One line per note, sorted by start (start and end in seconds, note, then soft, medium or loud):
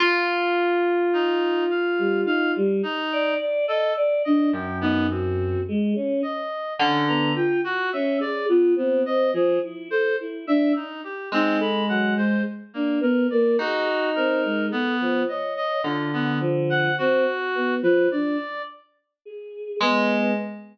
0.00 2.55 F4 loud
1.13 1.64 D#4 loud
1.70 2.21 F5 medium
1.98 2.24 G3 medium
2.25 2.51 D#4 medium
2.25 2.52 F5 loud
2.56 2.82 G3 loud
2.83 3.34 D#4 loud
3.12 3.38 D5 loud
3.40 3.66 D5 loud
3.67 3.93 A4 loud
3.67 3.92 D#5 medium
3.97 4.22 D5 loud
4.25 4.51 D4 medium
4.25 4.50 D#5 medium
4.53 5.55 F#2 medium
4.53 4.78 G5 medium
4.81 5.07 B3 loud
4.81 5.07 D#4 loud
5.09 5.60 C4 medium
5.09 5.62 F#4 medium
5.68 5.94 G#3 loud
5.96 6.21 C#4 medium
6.23 6.74 D#5 medium
6.79 7.30 D3 loud
6.79 7.05 C#4 medium
7.08 7.33 B3 medium
7.08 7.33 A#5 loud
7.35 7.60 F4 loud
7.35 7.61 G5 medium
7.64 7.90 F#4 loud
7.64 7.92 F#4 medium
7.92 8.19 C#4 loud
7.92 8.18 E5 medium
8.20 8.46 G#4 loud
8.20 8.46 D5 medium
8.49 8.75 B3 medium
8.49 8.74 F4 loud
8.76 9.03 B3 medium
8.76 9.01 C4 medium
9.04 9.30 C4 medium
9.04 9.31 D#5 loud
9.33 9.59 F3 loud
9.33 9.59 G#4 medium
9.63 9.88 E4 medium
9.91 10.16 A4 loud
9.91 10.16 C5 loud
10.20 10.46 E4 medium
10.47 10.73 D4 loud
10.47 10.73 E5 loud
10.75 11.01 D#4 medium
11.04 11.29 G4 medium
11.32 12.34 G#3 medium
11.32 11.58 C4 loud
11.32 11.59 D#4 medium
11.59 11.84 A4 medium
11.59 11.86 B5 medium
11.89 12.14 F#3 medium
11.89 12.14 F#5 medium
12.17 12.43 G#3 medium
12.17 12.42 C5 medium
12.74 12.99 A#3 medium
12.74 13.00 D4 medium
13.01 13.26 B3 loud
13.01 13.27 A#4 medium
13.30 13.57 A#3 loud
13.30 13.56 D5 medium
13.58 14.61 D#4 medium
13.58 14.09 F#4 loud
13.58 13.86 G#4 medium
14.15 14.41 C4 medium
14.15 14.66 A#4 medium
14.44 14.70 G#3 medium
14.70 15.23 B3 loud
14.70 14.96 A4 medium
15.00 15.26 F3 medium
15.28 15.80 C#5 medium
15.28 15.54 D#5 medium
15.57 15.82 D#5 loud
15.84 16.86 D3 medium
15.84 16.10 F4 soft
16.13 16.39 B3 medium
16.40 16.91 F3 medium
16.70 16.95 F#5 loud
16.98 17.24 C4 loud
16.98 17.75 F#4 loud
17.55 17.80 B3 medium
17.83 18.08 F3 loud
17.83 18.08 B4 medium
18.11 18.37 D4 medium
18.11 18.62 D5 medium
19.25 19.76 G#4 medium
19.80 20.31 G#3 loud
19.80 20.32 B3 medium